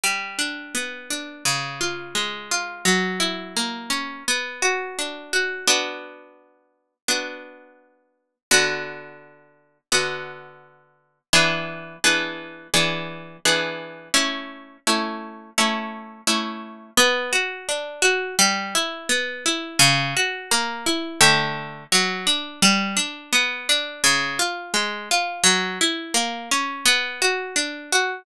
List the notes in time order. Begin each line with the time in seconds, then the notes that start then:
0.04 G3
0.39 D4
0.75 B3
1.10 D4
1.45 C#3
1.81 F4
2.15 G#3
2.51 F4
2.85 F#3
3.20 E4
3.57 A#3
3.90 C#4
4.28 B3
4.62 F#4
4.99 D4
5.33 F#4
5.67 B3 D4 F#4
7.08 B3 D4 F#4
8.51 D3 B3 F#4
9.92 D3 B3 F#4
11.33 E3 B3 D4 G#4
12.04 E3 B3 D4 G#4
12.74 E3 B3 D4 G#4
13.45 E3 B3 D4 G#4
14.14 A3 C#4 E4
14.87 A3 C#4 E4
15.58 A3 C#4 E4
16.27 A3 C#4 E4
16.97 B3
17.33 F#4
17.69 D4
18.02 F#4
18.39 G3
18.75 E4
19.09 B3
19.46 E4
19.79 C#3
20.17 F#4
20.51 A#3
20.86 E4
21.21 D3 A3 G4
21.92 F#3
22.27 D4
22.62 G3
22.97 D4
23.33 B3
23.69 D4
24.04 C#3
24.39 F4
24.74 G#3
25.11 F4
25.44 F#3
25.81 E4
26.14 A#3
26.51 C#4
26.86 B3
27.22 F#4
27.56 D4
27.92 F#4